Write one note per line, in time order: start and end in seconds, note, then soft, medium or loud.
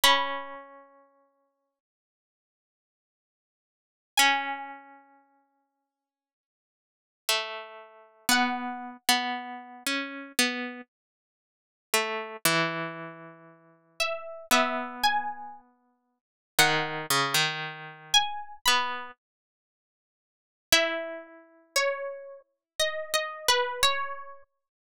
0.04 1.79 C#4 loud
0.04 0.93 B5 medium
4.17 6.84 C#4 loud
4.17 8.10 G#5 medium
7.29 8.26 A3 medium
8.29 8.97 B3 medium
8.29 12.36 F#5 medium
9.09 9.83 B3 medium
9.86 10.32 C#4 medium
10.39 10.81 B3 medium
11.94 12.37 A3 medium
12.45 14.26 E3 loud
14.00 14.46 E5 medium
14.51 16.18 B3 medium
14.51 14.95 E5 medium
15.03 16.54 G#5 medium
16.59 17.06 D#3 medium
16.59 17.05 F#5 medium
17.10 17.35 C#3 medium
17.34 18.23 D#3 medium
18.14 18.57 G#5 medium
18.66 19.11 B3 medium
18.66 19.09 B5 medium
20.72 24.19 E4 medium
20.72 21.55 E5 medium
21.76 22.61 C#5 medium
22.79 23.12 D#5 medium
23.14 23.47 D#5 medium
23.48 23.81 B4 medium
23.83 24.66 C#5 medium